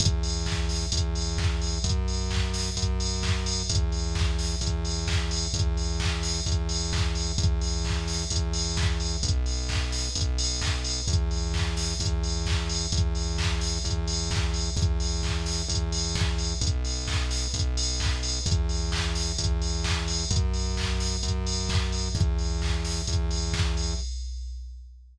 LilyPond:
<<
  \new Staff \with { instrumentName = "Synth Bass 1" } { \clef bass \time 4/4 \key e \minor \tempo 4 = 130 e,2 e,2 | fis,2 fis,2 | e,2 e,2 | e,2 e,2 |
e,2 e,2 | b,,2 b,,2 | e,2 e,2 | e,2 e,2 |
e,2 e,2 | b,,2 b,,2 | e,2 e,2 | fis,2 fis,2 |
e,2 e,2 | }
  \new DrumStaff \with { instrumentName = "Drums" } \drummode { \time 4/4 <hh bd>8 hho8 <hc bd>8 <hho sn>8 <hh bd>8 hho8 <hc bd>8 hho8 | <hh bd>8 hho8 <hc bd>8 <hho sn>8 <hh bd>8 hho8 <hc bd>8 hho8 | <hh bd>8 hho8 <hc bd>8 <hho sn>8 <hh bd>8 hho8 <hc bd>8 hho8 | <hh bd>8 hho8 <hc bd>8 <hho sn>8 <hh bd>8 hho8 <hc bd>8 hho8 |
<hh bd>8 hho8 <hc bd>8 <hho sn>8 <hh bd>8 hho8 <hc bd>8 hho8 | <hh bd>8 hho8 <hc bd>8 <hho sn>8 <hh bd>8 hho8 <hc bd>8 hho8 | <hh bd>8 hho8 <hc bd>8 <hho sn>8 <hh bd>8 hho8 <hc bd>8 hho8 | <hh bd>8 hho8 <hc bd>8 <hho sn>8 <hh bd>8 hho8 <hc bd>8 hho8 |
<hh bd>8 hho8 <hc bd>8 <hho sn>8 <hh bd>8 hho8 <hc bd>8 hho8 | <hh bd>8 hho8 <hc bd>8 <hho sn>8 <hh bd>8 hho8 <hc bd>8 hho8 | <hh bd>8 hho8 <hc bd>8 <hho sn>8 <hh bd>8 hho8 <hc bd>8 hho8 | <hh bd>8 hho8 <hc bd>8 <hho sn>8 <hh bd>8 hho8 <hc bd>8 hho8 |
<hh bd>8 hho8 <hc bd>8 <hho sn>8 <hh bd>8 hho8 <hc bd>8 hho8 | }
>>